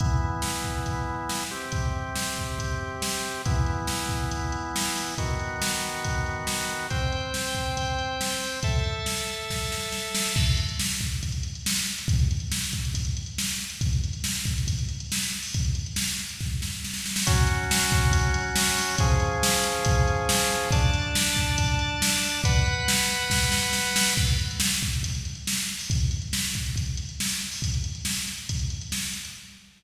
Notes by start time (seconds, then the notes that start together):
0.00 E3 B3 E4, kick, closed hi-hat
0.42 snare
0.64 kick
0.86 kick, closed hi-hat
1.29 snare
1.51 C3 C4 G4
1.72 kick, closed hi-hat
2.16 snare
2.38 kick
2.59 kick, closed hi-hat
3.02 snare
3.45 E3 B3 E4, kick, closed hi-hat
3.66 closed hi-hat
3.87 snare
4.09 kick, closed hi-hat
4.31 kick, closed hi-hat
4.52 closed hi-hat
4.76 snare
4.96 open hi-hat
5.18 D#3 B3 F#4, kick, closed hi-hat
5.40 closed hi-hat
5.62 snare
5.82 closed hi-hat
6.04 kick, closed hi-hat
6.26 closed hi-hat
6.47 snare
6.70 closed hi-hat
6.90 C4 C5 G5, kick, closed hi-hat
7.12 closed hi-hat
7.34 snare
7.55 kick, closed hi-hat
7.77 kick, closed hi-hat
7.99 closed hi-hat
8.21 snare
8.41 open hi-hat
8.63 A4 E5 A5, kick, closed hi-hat
8.84 closed hi-hat
9.06 snare
9.27 closed hi-hat
9.50 kick, snare
9.72 snare
9.92 snare
10.15 snare
10.36 kick, crash
10.46 closed hi-hat
10.57 closed hi-hat
10.69 closed hi-hat
10.79 snare
10.90 closed hi-hat
11.01 kick, closed hi-hat
11.12 closed hi-hat
11.23 kick, closed hi-hat
11.32 closed hi-hat
11.43 closed hi-hat
11.55 closed hi-hat
11.66 snare
11.76 closed hi-hat
11.86 closed hi-hat
11.98 closed hi-hat
12.08 kick, closed hi-hat
12.19 closed hi-hat
12.31 closed hi-hat
12.40 closed hi-hat
12.52 snare
12.64 closed hi-hat
12.73 kick, closed hi-hat
12.85 closed hi-hat
12.94 kick, closed hi-hat
13.05 closed hi-hat
13.17 closed hi-hat
13.26 closed hi-hat
13.38 snare
13.49 closed hi-hat
13.60 closed hi-hat
13.70 closed hi-hat
13.81 kick, closed hi-hat
13.93 closed hi-hat
14.04 closed hi-hat
14.13 closed hi-hat
14.24 snare
14.35 closed hi-hat
14.46 kick, closed hi-hat
14.58 closed hi-hat
14.67 kick, closed hi-hat
14.79 closed hi-hat
14.89 closed hi-hat
15.00 closed hi-hat
15.12 snare
15.23 closed hi-hat
15.33 closed hi-hat
15.43 open hi-hat
15.54 kick, closed hi-hat
15.65 closed hi-hat
15.75 closed hi-hat
15.86 closed hi-hat
15.96 snare
16.08 closed hi-hat
16.19 closed hi-hat
16.29 closed hi-hat
16.40 kick, snare
16.62 snare
16.84 snare
16.94 snare
17.06 snare
17.16 snare
17.27 F#3 C#4 F#4, kick, closed hi-hat
17.47 closed hi-hat
17.71 snare
17.92 kick, closed hi-hat
18.12 kick, closed hi-hat
18.34 closed hi-hat
18.56 snare
18.77 open hi-hat
18.98 F3 C#4 G#4, kick, closed hi-hat
19.20 closed hi-hat
19.43 snare
19.64 closed hi-hat
19.85 kick, closed hi-hat
20.08 closed hi-hat
20.29 snare
20.50 closed hi-hat
20.71 D4 D5 A5, kick, closed hi-hat
20.94 closed hi-hat
21.15 snare
21.37 kick, closed hi-hat
21.58 kick, closed hi-hat
21.79 closed hi-hat
22.02 snare
22.23 open hi-hat
22.44 B4 F#5 B5, kick, closed hi-hat
22.66 closed hi-hat
22.88 snare
23.10 closed hi-hat
23.30 kick, snare
23.52 snare
23.73 snare
23.96 snare
24.17 kick, crash
24.27 closed hi-hat
24.39 closed hi-hat
24.51 closed hi-hat
24.60 snare
24.70 closed hi-hat
24.83 kick, closed hi-hat
24.93 closed hi-hat
25.03 kick, closed hi-hat
25.15 closed hi-hat
25.25 closed hi-hat
25.35 closed hi-hat
25.47 snare
25.58 closed hi-hat
25.69 closed hi-hat
25.79 open hi-hat
25.90 kick, closed hi-hat
26.00 closed hi-hat
26.11 closed hi-hat
26.22 closed hi-hat
26.33 snare
26.44 closed hi-hat
26.54 kick, closed hi-hat
26.66 closed hi-hat
26.76 kick, closed hi-hat
26.86 closed hi-hat
26.97 closed hi-hat
27.09 closed hi-hat
27.20 snare
27.29 closed hi-hat
27.41 closed hi-hat
27.52 open hi-hat
27.62 kick, closed hi-hat
27.74 closed hi-hat
27.84 closed hi-hat
27.95 closed hi-hat
28.05 snare
28.17 closed hi-hat
28.28 closed hi-hat
28.38 closed hi-hat
28.49 kick, closed hi-hat
28.59 closed hi-hat
28.70 closed hi-hat
28.81 closed hi-hat
28.92 snare
29.03 closed hi-hat
29.13 closed hi-hat
29.25 closed hi-hat